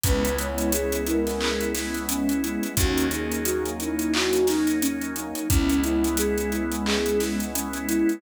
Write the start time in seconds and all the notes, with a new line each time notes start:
0.04 C#2 G#3 B3 C#4 E4 B4, kick, closed hi-hat
0.24 G#3 B3 C#4 E4, closed hi-hat
0.38 G#3 B3 C#4 E4 C#5, closed hi-hat
0.58 closed hi-hat
0.72 G#3 B3 C#4 E4 G#4, closed hi-hat
0.92 G#3 B3 C#4 E4, closed hi-hat
1.07 E4 A#4, closed hi-hat
1.27 G#3 B3 C#4 E4, snare, closed hi-hat
1.41 G#4, clap
1.61 G#3 B3 C#4 E4, closed hi-hat
1.75 G#3 B3 C#4 E4, snare, closed hi-hat
1.94 G#3 B3 C#4 E4, closed hi-hat
2.09 G#3 B3 C#4 E4, closed hi-hat
2.29 G#3 B3 C#4 E4, closed hi-hat
2.43 G#3 B3 C#4 E4, closed hi-hat
2.63 G#3 B3 C#4 E4, closed hi-hat
2.77 D#2 F#3 A#3 C#4 D#4 F#4, kick, closed hi-hat
2.97 F#3 A#3 C#4 D#4, closed hi-hat
3.11 F#3 A#3 C#4 D#4 G#4, closed hi-hat
3.32 closed hi-hat
3.45 F#3 A#3 C#4 D#4 F#4, closed hi-hat
3.65 F#3 A#3 C#4 D#4, closed hi-hat
3.79 D#4 E4, closed hi-hat
3.99 F#3 A#3 C#4 D#4, closed hi-hat
4.13 F#4, clap
4.33 F#3 A#3 C#4 D#4, closed hi-hat
4.47 F#3 A#3 C#4 D#4, snare, closed hi-hat
4.67 F#3 A#3 C#4 D#4, closed hi-hat
4.82 F#3 A#3 C#4 D#4, closed hi-hat
5.01 F#3 A#3 C#4 D#4, closed hi-hat
5.15 F#3 A#3 C#4 D#4, closed hi-hat
5.35 F#3 A#3 C#4 D#4, closed hi-hat
5.49 C#2 G#3 B3 C#4 E4, kick, closed hi-hat
5.69 G#3 B3 C#4 E4, closed hi-hat
5.84 G#3 B3 C#4 E4, closed hi-hat
6.04 closed hi-hat
6.17 G#3 B3 C#4 E4 G#4, closed hi-hat
6.38 G#3 B3 C#4 E4, closed hi-hat
6.52 E4, closed hi-hat
6.72 G#3 B3 C#4 E4, closed hi-hat
6.86 G#4, clap
7.06 G#3 B3 C#4 E4, closed hi-hat
7.20 G#3 B3 C#4 E4, snare, closed hi-hat
7.40 G#3 B3 C#4 E4, closed hi-hat
7.54 G#3 B3 C#4 E4, closed hi-hat
7.73 G#3 B3 C#4 E4, closed hi-hat
7.88 G#3 B3 C#4 E4, closed hi-hat
8.08 G#3 B3 C#4 E4, closed hi-hat